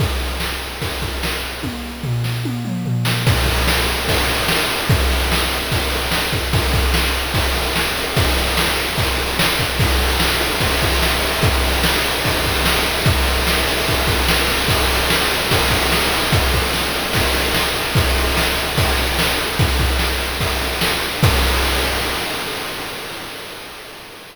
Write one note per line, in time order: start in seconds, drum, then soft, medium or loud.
0.00 kick medium
0.00 ride medium
0.40 snare medium
0.82 kick medium
0.82 ride medium
1.02 kick medium
1.23 snare medium
1.63 kick medium
1.63 high tom medium
2.03 floor tom medium
2.24 snare medium
2.45 high tom medium
2.65 mid tom medium
2.85 floor tom medium
3.05 snare medium
3.27 kick loud
3.27 crash loud
3.46 kick medium
3.46 ride medium
3.68 snare loud
3.88 ride medium
4.08 kick medium
4.08 ride medium
4.28 ride medium
4.48 snare medium
4.70 ride medium
4.89 kick loud
4.89 ride medium
5.11 ride medium
5.32 snare medium
5.51 ride medium
5.72 kick medium
5.72 ride medium
5.92 ride medium
6.11 snare medium
6.33 kick medium
6.33 ride medium
6.53 kick medium
6.53 ride medium
6.73 kick medium
6.73 ride medium
6.94 snare medium
7.14 ride medium
7.34 kick medium
7.34 ride medium
7.56 ride medium
7.76 snare medium
7.96 ride medium
8.16 kick medium
8.16 ride medium
8.37 ride medium
8.57 snare medium
8.78 ride medium
8.98 kick medium
8.98 ride medium
9.18 ride medium
9.39 snare loud
9.59 kick medium
9.59 ride medium
9.79 kick medium
9.79 crash medium
9.89 ride medium
10.01 ride medium
10.10 ride medium
10.20 snare medium
10.32 ride medium
10.41 ride medium
10.51 ride medium
10.60 kick medium
10.60 ride medium
10.71 ride medium
10.81 kick medium
10.81 ride medium
10.92 ride medium
11.02 snare medium
11.12 ride medium
11.22 ride medium
11.32 ride medium
11.42 kick medium
11.42 ride medium
11.54 ride medium
11.64 ride medium
11.73 ride medium
11.84 snare loud
11.94 ride medium
12.05 ride medium
12.14 ride medium
12.25 kick medium
12.25 ride medium
12.35 ride medium
12.44 kick medium
12.44 ride medium
12.55 ride medium
12.65 snare loud
12.75 ride medium
12.86 ride medium
12.97 ride medium
13.05 kick loud
13.05 ride medium
13.17 ride medium
13.25 ride medium
13.37 ride medium
13.47 snare medium
13.57 ride medium
13.67 ride medium
13.77 ride medium
13.87 kick medium
13.87 ride medium
13.98 ride medium
14.07 kick medium
14.07 ride medium
14.19 ride medium
14.28 snare loud
14.38 ride medium
14.49 ride medium
14.60 ride medium
14.68 kick medium
14.68 ride medium
14.78 ride medium
14.90 ride medium
15.00 ride medium
15.10 snare medium
15.20 ride medium
15.31 ride medium
15.41 ride medium
15.51 kick medium
15.51 ride loud
15.61 ride medium
15.70 kick medium
15.70 ride medium
15.82 ride medium
15.92 snare medium
16.02 ride medium
16.12 ride medium
16.22 ride medium
16.32 kick medium
16.32 ride medium
16.54 kick medium
16.54 ride medium
16.74 snare medium
16.95 ride medium
17.13 kick medium
17.13 ride medium
17.34 ride medium
17.54 snare medium
17.76 ride medium
17.95 kick medium
17.95 ride medium
18.16 ride medium
18.37 snare medium
18.57 ride medium
18.77 kick medium
18.77 ride medium
18.98 ride medium
19.19 snare loud
19.38 ride medium
19.59 kick medium
19.59 ride medium
19.79 kick medium
19.79 ride medium
19.99 snare medium
20.20 ride medium
20.40 kick medium
20.40 ride medium
20.61 ride medium
20.81 snare medium
21.02 ride medium
21.23 kick loud
21.23 crash loud